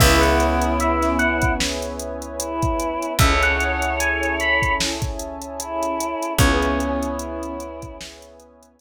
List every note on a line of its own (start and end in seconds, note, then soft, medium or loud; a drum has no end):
0.00 2.97 C#2 loud
0.00 3.15 B3 loud
0.00 3.15 C#4 medium
0.00 1.53 E4 medium
0.00 3.15 E4 medium
0.00 3.15 G#4 medium
0.00 3.17 B4 medium
0.00 3.17 C#5 medium
0.00 0.21 E5 loud
0.00 3.17 E5 medium
0.00 3.17 G#5 medium
0.00 kick loud
0.00 crash loud
0.21 0.71 F#5 medium
0.21 closed hi-hat medium
0.40 closed hi-hat medium
0.61 closed hi-hat medium
0.80 1.17 E5 loud
0.80 closed hi-hat medium
1.02 snare soft
1.02 closed hi-hat medium
1.19 1.54 F#5 loud
1.19 closed hi-hat medium
1.42 kick medium
1.42 closed hi-hat medium
1.60 snare loud
1.82 closed hi-hat medium
2.00 closed hi-hat medium
2.22 closed hi-hat medium
2.40 3.13 E4 medium
2.40 closed hi-hat loud
2.62 kick medium
2.62 closed hi-hat medium
2.80 closed hi-hat medium
3.03 closed hi-hat medium
3.19 6.15 C#2 medium
3.19 6.35 C#4 medium
3.19 6.35 E4 medium
3.19 6.35 G#4 medium
3.19 6.35 A4 medium
3.19 4.73 C#5 medium
3.19 6.37 C#5 medium
3.19 3.41 E5 loud
3.19 6.37 E5 medium
3.19 6.37 G#5 medium
3.19 6.37 A5 medium
3.19 kick loud
3.19 closed hi-hat medium
3.43 3.93 F#5 loud
3.43 closed hi-hat medium
3.61 closed hi-hat medium
3.82 closed hi-hat medium
4.00 4.34 G#5 loud
4.00 closed hi-hat loud
4.23 closed hi-hat medium
4.40 4.74 B5 loud
4.40 closed hi-hat medium
4.62 kick medium
4.62 closed hi-hat medium
4.80 snare loud
5.02 kick medium
5.02 closed hi-hat medium
5.20 closed hi-hat medium
5.42 closed hi-hat medium
5.60 6.33 E4 medium
5.60 closed hi-hat loud
5.83 closed hi-hat medium
6.01 closed hi-hat medium
6.23 closed hi-hat medium
6.39 8.81 C#2 medium
6.39 8.81 B3 loud
6.39 8.81 C#4 loud
6.39 7.10 C#4 medium
6.39 8.81 E4 medium
6.39 8.81 G#4 medium
6.39 8.81 B4 medium
6.39 7.80 C#5 loud
6.39 8.81 C#5 medium
6.39 8.81 E5 medium
6.39 8.81 G#5 medium
6.39 kick loud
6.39 closed hi-hat medium
6.62 closed hi-hat medium
6.80 closed hi-hat medium
7.03 closed hi-hat medium
7.19 7.96 E4 medium
7.19 closed hi-hat medium
7.43 closed hi-hat medium
7.60 closed hi-hat medium
7.82 kick medium
7.82 closed hi-hat medium
8.01 snare loud
8.22 closed hi-hat medium
8.40 closed hi-hat medium
8.63 closed hi-hat medium
8.79 closed hi-hat loud